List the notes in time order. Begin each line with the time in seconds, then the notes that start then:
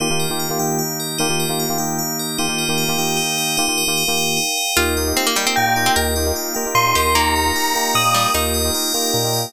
0.00 D#3 A#3 D#4 F4 G4
0.10 D#3 A#3 F4 G4
0.20 A#4
0.30 D#3 A#3 F4 G4
0.39 F5
0.50 D#3 A#3 F4 G4
0.59 D#3 A#3 D#4 G4 G5
0.79 F5
1.00 A#4
1.18 D#3 A#3 D#4 F4 G4
1.29 D#3 A#3 F4 G4
1.40 A#4
1.49 D#3 A#3 F4 G4
1.60 F5
1.69 D#3 A#3 F4 G4
1.78 D#3 A#3 D#4 G4 G5
1.99 F5
2.19 A#4
2.38 D#3 A#3 D#4 F4 G4
2.48 D#3 A#3 F4 G4
2.58 A#4
2.68 D#3 A#3 F4 G4
2.78 F5
2.88 D#3 A#3 F4 G4
2.98 D#3 A#3 D#4 G4 G5
3.17 D#4
3.38 A#4
3.57 D#3 A#3 D#4 F4 G4
3.68 D#3 A#3 F4 G4
3.78 A#4
3.87 D#3 A#3 F4 G4
3.97 F5
4.08 D#3 A#3 F4 G4
4.17 G5
4.37 D#4
4.58 A#4
4.76 D#2 A#3 D#4 F4 G4 A#4
4.97 A#3 D#4 F4 G4 D#5
5.07 A#3 D#4 F4 G4
5.17 C4 F5
5.27 A#3
5.36 G3 A#3 D#4 F4 G4 A#4 G5
5.46 A#3 C4 D#4 F4 G4
5.56 A#2 F5 G5
5.66 A#3 D#4 F4 G4
5.76 A#3 D#4 F4 G4 D#5
5.86 C4
5.96 D#2 A#3 D#4 F4 G4 A#4
6.16 A#3 D#4 F4 G4 D#5
6.26 A#3 D#4 F4 G4
6.36 F5
6.55 A#3 D#4 F4 G4 A#4 G5
6.66 A#3 D#4 F4 G4
6.75 A#2 F5 C6
6.86 A#3 D#4 F4 G4
6.95 D#2 G4 A#4
7.05 A#3 D#4 F4 G4
7.15 A#3 D#4 F4 G4 A#5
7.36 D#5
7.45 A#3 D#4 F4 G4
7.55 A#3 D#4 F4 G4 F5
7.75 A#3 D#4 F4 G4 A#4 G5
7.95 A#2 A#4 D#6
8.05 A#3 D#4 F4 G4
8.14 G3 D#5
8.34 D#2 A#3 D#4 F4 G4 A#4
8.54 D#5
8.64 A#3 D#4 F4 G4
8.74 A#3 D#4 F4 G4 F5
8.94 A#3 D#4 F4 G4 A#4 G5
9.14 A#2 A#4
9.24 A#3 D#4 F4 G4
9.33 D#5